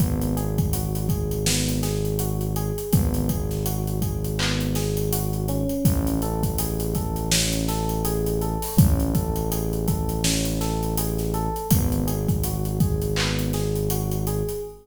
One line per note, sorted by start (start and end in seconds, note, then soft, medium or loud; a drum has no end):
0.00 2.71 G#1 medium
0.00 0.34 B3 loud
0.00 kick medium
0.00 closed hi-hat medium
0.21 closed hi-hat medium
0.37 0.70 G#4 medium
0.37 closed hi-hat medium
0.58 kick medium
0.58 closed hi-hat medium
0.73 1.07 F#4 medium
0.73 closed hi-hat medium
0.95 closed hi-hat medium
1.09 1.43 G#4 medium
1.09 kick medium
1.09 closed hi-hat medium
1.31 closed hi-hat medium
1.46 1.80 B3 medium
1.46 snare medium
1.69 closed hi-hat medium
1.83 2.16 G#4 medium
1.83 snare soft
1.83 closed hi-hat medium
2.05 closed hi-hat medium
2.19 2.53 F#4 medium
2.19 closed hi-hat medium
2.41 closed hi-hat medium
2.56 2.90 G#4 medium
2.56 closed hi-hat medium
2.78 closed hi-hat medium
2.93 5.65 G#1 medium
2.93 3.26 B3 loud
2.93 kick medium
2.93 closed hi-hat medium
3.14 closed hi-hat medium
3.29 3.63 G#4 medium
3.29 kick medium
3.29 closed hi-hat medium
3.51 snare soft
3.51 closed hi-hat medium
3.66 3.99 F#4 medium
3.66 closed hi-hat medium
3.87 closed hi-hat medium
4.02 4.36 G#4 medium
4.02 kick medium
4.02 closed hi-hat medium
4.24 closed hi-hat medium
4.39 4.73 B3 medium
4.39 clap medium
4.60 closed hi-hat medium
4.75 5.09 G#4 medium
4.75 snare medium
4.75 closed hi-hat medium
4.97 closed hi-hat medium
5.12 5.46 F#4 medium
5.12 closed hi-hat medium
5.33 closed hi-hat soft
5.48 6.19 C#4 loud
5.48 closed hi-hat medium
5.69 closed hi-hat medium
5.85 8.57 A1 medium
5.85 kick medium
5.85 closed hi-hat medium
6.07 closed hi-hat medium
6.22 6.56 A4 medium
6.22 closed hi-hat medium
6.43 kick medium
6.43 closed hi-hat medium
6.58 6.92 G#4 medium
6.58 closed hi-hat medium
6.80 closed hi-hat medium
6.95 7.29 A4 medium
6.95 kick medium
6.95 closed hi-hat medium
7.16 closed hi-hat medium
7.32 7.65 C#4 medium
7.32 snare medium
7.52 closed hi-hat medium
7.68 8.02 A4 medium
7.68 snare soft
7.68 closed hi-hat medium
7.89 closed hi-hat medium
8.05 8.38 G#4 loud
8.05 closed hi-hat medium
8.26 closed hi-hat medium
8.41 8.75 A4 medium
8.41 closed hi-hat medium
8.62 open hi-hat medium
8.77 11.49 A1 medium
8.77 9.11 C#4 loud
8.77 kick loud
8.77 closed hi-hat medium
9.00 closed hi-hat medium
9.14 9.48 A4 medium
9.14 kick medium
9.14 closed hi-hat medium
9.36 closed hi-hat medium
9.51 9.85 G#4 medium
9.51 closed hi-hat medium
9.73 closed hi-hat medium
9.88 10.21 A4 medium
9.88 kick medium
9.88 closed hi-hat medium
10.09 closed hi-hat medium
10.24 10.58 C#4 medium
10.24 snare medium
10.45 closed hi-hat medium
10.61 10.94 A4 medium
10.61 snare soft
10.61 closed hi-hat medium
10.83 closed hi-hat medium
10.97 11.31 G#4 medium
10.97 closed hi-hat medium
11.18 snare soft
11.18 closed hi-hat medium
11.34 11.68 A4 loud
11.34 closed hi-hat medium
11.56 closed hi-hat medium
11.70 14.42 G#1 medium
11.70 12.05 B3 loud
11.70 kick medium
11.70 closed hi-hat loud
11.92 closed hi-hat medium
12.07 12.41 G#4 medium
12.07 closed hi-hat medium
12.29 kick medium
12.29 closed hi-hat medium
12.43 12.78 F#4 medium
12.43 closed hi-hat medium
12.65 closed hi-hat medium
12.80 13.14 G#4 medium
12.80 kick medium
12.80 closed hi-hat medium
13.02 closed hi-hat medium
13.16 13.51 B3 medium
13.16 clap medium
13.39 closed hi-hat medium
13.53 13.87 G#4 medium
13.53 snare soft
13.53 closed hi-hat medium
13.75 closed hi-hat medium
13.90 14.24 F#4 medium
13.90 closed hi-hat medium
14.11 closed hi-hat medium
14.27 14.61 G#4 medium
14.27 closed hi-hat medium
14.49 closed hi-hat medium